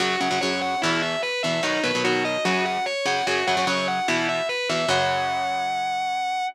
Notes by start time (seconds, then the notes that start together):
0.00 F#2 C#3 F#3 F#4
0.20 F#2 C#3 F#3 F#5
0.31 F#2 C#3 F#3
0.41 F#2 C#3 F#3 C#5
0.61 F#5
0.82 E2 B2 E3 E4
1.02 E5
1.22 B4
1.43 E2 B2 E3 E5
1.63 B2 D#3 F#3 D#4
1.84 B2 D#3 F#3 B4
1.95 B2 D#3 F#3
2.04 B2 D#3 F#3 F#4
2.24 D#5
2.45 F#2 C#3 F#3 F#4
2.65 F#5
2.86 C#5
3.05 F#2 C#3 F#3 F#5
3.27 F#2 C#3 F#3 F#4
3.47 F#2 C#3 F#3 F#5
3.57 F#2 C#3 F#3
3.67 F#2 C#3 F#3 C#5
3.88 F#5
4.08 E2 B2 E3 E4
4.29 E5
4.49 B4
4.69 E2 B2 E3 E5
4.89 F#2 C#3 F#3 F#5